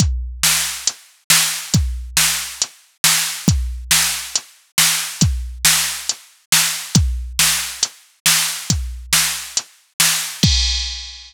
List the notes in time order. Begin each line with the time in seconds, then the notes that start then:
0.00 kick, closed hi-hat
0.43 snare
0.87 closed hi-hat
1.30 snare
1.74 kick, closed hi-hat
2.17 snare
2.62 closed hi-hat
3.04 snare
3.48 kick, closed hi-hat
3.91 snare
4.36 closed hi-hat
4.78 snare
5.21 kick, closed hi-hat
5.65 snare
6.09 closed hi-hat
6.52 snare
6.95 kick, closed hi-hat
7.39 snare
7.83 closed hi-hat
8.26 snare
8.70 kick, closed hi-hat
9.13 snare
9.57 closed hi-hat
10.00 snare
10.43 kick, crash